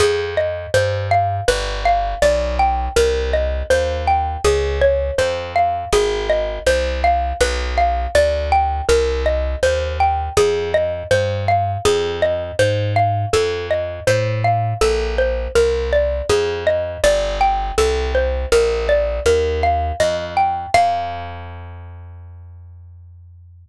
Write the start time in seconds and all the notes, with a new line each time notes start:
0.00 F2 G#4
0.37 D#5
0.74 G2 C5
1.11 F5
1.48 G1 B4
1.85 F5
2.22 B1 D5
2.59 G5
2.96 C2 A#4
3.33 D#5
3.70 D#2 C5
4.07 G5
4.44 C#2 G#4
4.81 C#5
5.18 F2 C5
5.56 F5
5.93 G#1 G#4
6.29 D#5
6.67 C2 C5
7.04 F5
7.41 B1 B4
7.78 F5
8.15 D2 D5
8.52 G5
8.89 C2 A#4
9.26 D#5
9.63 D#2 C5
10.00 G5
10.37 F2 G#4
10.74 D#5
11.11 G2 C5
11.48 F5
11.85 F2 G#4
12.22 D#5
12.59 G#2 C5
12.96 F5
13.33 F2 A4
13.71 D#5
14.07 A2 C5
14.44 F5
14.81 A#1 A4
15.18 C5
15.55 C2 A#4
15.93 D5
16.29 F2 G#4
16.67 D#5
17.04 G1 D5
17.41 G5
17.78 C2 A4
18.15 C5
18.52 A#1 A#4
18.89 D5
19.26 D#2 A#4
19.63 F5
20.00 F2 D#5
20.37 G5
20.74 F2 F5